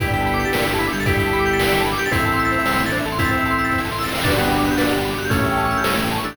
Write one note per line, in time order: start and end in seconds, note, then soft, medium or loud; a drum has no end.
0.00 0.45 G1 medium
0.00 0.48 B3 medium
0.00 2.09 B3 medium
0.00 2.09 D4 medium
0.00 0.48 D4 medium
0.00 0.73 E4 medium
0.00 0.73 G4 medium
0.00 2.09 G4 medium
0.00 2.09 A4 loud
0.00 0.06 B4 loud
0.00 kick medium
0.00 closed hi-hat medium
0.05 0.48 G4 medium
0.05 0.48 A4 medium
0.05 0.13 D5 medium
0.05 closed hi-hat medium
0.13 0.20 G5 medium
0.13 closed hi-hat medium
0.20 0.27 A5 medium
0.20 closed hi-hat medium
0.26 0.32 B5 medium
0.26 closed hi-hat medium
0.33 0.40 D6 loud
0.33 closed hi-hat medium
0.40 0.46 G6 medium
0.40 closed hi-hat medium
0.45 0.51 A6 medium
0.45 closed hi-hat medium
0.53 0.65 A#1 medium
0.53 0.64 A#3 medium
0.53 0.59 B4 medium
0.53 snare loud
0.58 0.64 D5 medium
0.58 closed hi-hat medium
0.66 0.89 G1 medium
0.66 0.89 G3 medium
0.66 0.72 G5 medium
0.66 closed hi-hat medium
0.73 0.80 A5 loud
0.73 closed hi-hat medium
0.79 0.92 E4 medium
0.79 0.85 B5 loud
0.79 closed hi-hat medium
0.86 0.93 D6 medium
0.86 closed hi-hat medium
0.93 1.94 G1 medium
0.93 1.94 G3 medium
0.93 0.99 G6 medium
0.93 closed hi-hat medium
1.00 1.06 A6 medium
1.00 closed hi-hat medium
1.06 1.82 E4 medium
1.06 1.82 G4 medium
1.06 1.12 B4 loud
1.06 kick medium
1.06 closed hi-hat medium
1.13 1.20 D5 medium
1.13 closed hi-hat medium
1.19 1.25 G5 medium
1.19 closed hi-hat medium
1.26 1.32 A5 medium
1.26 closed hi-hat medium
1.33 1.39 B5 loud
1.33 closed hi-hat medium
1.39 1.45 D6 loud
1.39 closed hi-hat medium
1.46 1.52 G6 medium
1.46 closed hi-hat medium
1.53 1.59 A6 medium
1.53 closed hi-hat medium
1.59 1.65 B4 medium
1.59 snare loud
1.66 1.72 D5 loud
1.66 closed hi-hat medium
1.73 1.79 G5 medium
1.73 closed hi-hat medium
1.79 1.86 A5 loud
1.79 closed hi-hat medium
1.85 1.91 B5 medium
1.85 closed hi-hat medium
1.92 1.98 D6 medium
1.92 closed hi-hat medium
1.98 2.10 G4 medium
1.98 2.04 G6 medium
1.98 closed hi-hat medium
2.06 2.12 A6 loud
2.06 closed hi-hat medium
2.12 2.58 A1 medium
2.12 2.83 C4 medium
2.12 2.60 C4 medium
2.12 4.23 C4 medium
2.12 2.83 E4 medium
2.12 4.23 E4 medium
2.12 2.60 E4 medium
2.12 4.23 A4 medium
2.12 2.17 C5 loud
2.12 kick medium
2.12 closed hi-hat medium
2.17 2.60 A4 medium
2.17 2.25 E5 loud
2.17 closed hi-hat medium
2.25 2.31 A5 medium
2.25 closed hi-hat medium
2.32 2.40 C6 loud
2.32 closed hi-hat medium
2.39 2.45 E6 loud
2.39 closed hi-hat medium
2.45 2.51 A6 medium
2.45 closed hi-hat medium
2.52 2.58 C5 medium
2.52 closed hi-hat medium
2.58 2.64 E5 medium
2.58 closed hi-hat medium
2.65 2.77 C2 medium
2.65 2.77 C3 medium
2.65 2.72 A5 medium
2.65 snare medium
2.72 2.78 C6 medium
2.72 closed hi-hat medium
2.78 3.01 A1 medium
2.78 3.01 A3 medium
2.78 2.84 E6 medium
2.78 closed hi-hat medium
2.85 2.92 A6 medium
2.85 closed hi-hat medium
2.92 3.05 D4 medium
2.92 2.98 C5 loud
2.92 closed hi-hat medium
2.99 3.05 E5 medium
2.99 closed hi-hat medium
3.05 4.07 A1 medium
3.05 4.07 A3 medium
3.05 3.12 A5 medium
3.05 closed hi-hat medium
3.12 3.18 C6 loud
3.12 closed hi-hat medium
3.19 3.80 C4 medium
3.19 3.80 E4 medium
3.19 3.25 E6 loud
3.19 kick medium
3.19 closed hi-hat medium
3.24 3.30 A6 loud
3.24 closed hi-hat medium
3.31 3.37 C5 medium
3.31 closed hi-hat medium
3.37 3.43 E5 medium
3.37 closed hi-hat medium
3.45 3.52 A5 loud
3.45 closed hi-hat medium
3.51 3.57 C6 loud
3.51 closed hi-hat medium
3.58 3.64 E6 medium
3.58 closed hi-hat medium
3.65 3.71 A6 medium
3.65 closed hi-hat medium
3.72 3.78 C5 medium
3.72 kick medium
3.72 snare medium
3.78 3.85 E5 medium
3.78 snare medium
3.85 3.91 A5 medium
3.85 snare medium
3.91 3.97 C6 medium
3.91 snare medium
3.98 4.05 E6 loud
3.98 snare medium
4.01 4.10 A6 medium
4.01 snare medium
4.05 snare medium
4.08 snare medium
4.12 4.19 C5 medium
4.12 snare medium
4.15 4.23 E5 loud
4.15 snare medium
4.18 snare medium
4.22 4.70 G1 medium
4.22 5.29 B3 medium
4.22 4.73 B3 medium
4.22 4.35 D4 medium
4.22 5.29 D4 medium
4.22 5.29 F#4 medium
4.22 5.29 G4 medium
4.22 4.31 B4 loud
4.22 kick medium
4.22 snare medium
4.22 crash medium
4.27 4.73 D4 medium
4.27 4.73 F#4 medium
4.27 closed hi-hat medium
4.32 4.73 G4 medium
4.32 4.38 D5 medium
4.38 4.50 B3 medium
4.38 4.44 F#5 medium
4.38 closed hi-hat medium
4.45 4.51 G5 medium
4.45 closed hi-hat medium
4.51 4.57 B5 medium
4.51 closed hi-hat medium
4.58 4.64 D6 medium
4.58 closed hi-hat medium
4.65 4.77 B3 medium
4.65 4.72 F#6 medium
4.65 closed hi-hat medium
4.71 4.77 G6 medium
4.71 closed hi-hat medium
4.77 4.89 A#1 medium
4.77 4.89 A#3 medium
4.77 4.99 D4 medium
4.77 4.84 B4 loud
4.77 snare medium
4.84 4.92 D5 medium
4.84 closed hi-hat medium
4.90 5.14 G1 medium
4.90 5.14 G3 medium
4.90 4.96 F#5 medium
4.90 closed hi-hat medium
4.98 5.04 G5 medium
4.98 closed hi-hat medium
5.05 5.11 B5 medium
5.05 closed hi-hat medium
5.10 5.16 D6 medium
5.10 closed hi-hat medium
5.17 5.29 G1 medium
5.17 5.29 G3 medium
5.17 5.25 F#6 medium
5.17 closed hi-hat medium
5.24 5.31 G6 loud
5.24 closed hi-hat medium
5.30 5.76 A1 medium
5.30 6.35 A3 medium
5.30 5.94 A3 medium
5.30 5.79 A3 medium
5.30 6.35 C#4 medium
5.30 5.94 C#4 medium
5.30 5.79 C#4 medium
5.30 6.35 E4 medium
5.30 6.35 G4 medium
5.30 5.37 A4 loud
5.30 kick medium
5.30 closed hi-hat medium
5.36 5.79 E4 medium
5.36 5.79 G4 medium
5.36 5.44 C#5 medium
5.36 closed hi-hat medium
5.44 5.51 E5 medium
5.44 closed hi-hat medium
5.51 5.58 G5 medium
5.51 closed hi-hat medium
5.57 5.63 A5 loud
5.57 closed hi-hat medium
5.64 5.71 C#6 loud
5.64 closed hi-hat medium
5.71 5.77 E6 medium
5.71 closed hi-hat medium
5.77 5.83 G6 medium
5.77 closed hi-hat medium
5.84 5.95 C2 medium
5.84 5.95 C3 medium
5.84 5.90 A4 medium
5.84 snare loud
5.91 5.98 C#5 medium
5.91 closed hi-hat medium
5.97 6.20 A1 medium
5.97 6.20 A3 medium
5.97 6.03 E5 medium
5.97 closed hi-hat medium
6.04 6.10 G5 medium
6.04 closed hi-hat medium
6.11 6.17 A5 loud
6.11 closed hi-hat medium
6.17 6.24 C#6 medium
6.17 closed hi-hat medium
6.24 6.35 A1 medium
6.24 6.35 A3 medium
6.24 6.37 D4 medium
6.24 6.30 E6 medium
6.24 closed hi-hat medium
6.30 6.37 G6 medium
6.30 closed hi-hat medium